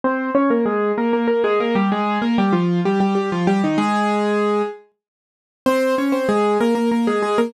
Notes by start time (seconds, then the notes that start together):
0.04 C4 C5
0.35 C#4 C#5
0.50 A#3 A#4
0.66 G#3 G#4
0.98 A#3 A#4
1.13 A#3 A#4
1.28 A#3 A#4
1.44 G#3 G#4
1.60 A#3 A#4
1.75 G3 G4
1.92 G#3 G#4
2.22 A#3 A#4
2.38 G3 G4
2.53 F3 F4
2.85 G3 G4
3.00 G3 G4
3.15 G3 G4
3.32 F3 F4
3.47 G3 G4
3.64 D#3 D#4
3.78 G#3 G#4
5.66 C4 C5
5.98 C#4 C#5
6.12 C4 C5
6.29 G#3 G#4
6.61 A#3 A#4
6.75 A#3 A#4
6.92 A#3 A#4
7.07 G#3 G#4
7.23 G#3 G#4
7.38 A#3 A#4